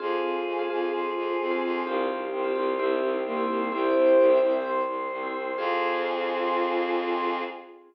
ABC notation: X:1
M:4/4
L:1/16
Q:1/4=129
K:Fm
V:1 name="Choir Aahs"
[FA]16 | [EG]16 | [=EG]6 z10 | F16 |]
V:2 name="Ocarina"
z12 C4 | z12 B,4 | c10 z6 | F16 |]
V:3 name="Vibraphone"
[CFA]5 [CFA] [CFA]7 [CFA]3 | [CFG]5 [CFG] [CFG]2 [C=EG]5 [CEG]3 | [C=EG]5 [CEG] [CEG]7 [CEG]3 | [CFA]16 |]
V:4 name="Violin" clef=bass
F,,2 F,,2 F,,2 F,,2 F,,2 F,,2 F,,2 F,,2 | C,,2 C,,2 C,,2 C,,2 C,,2 C,,2 C,,2 C,,2 | C,,2 C,,2 C,,2 C,,2 C,,2 C,,2 C,,2 C,,2 | F,,16 |]
V:5 name="Choir Aahs"
[cfa]8 [cac']8 | [cfg]4 [cgc']4 [c=eg]4 [cgc']4 | [c=eg]8 [cgc']8 | [CFA]16 |]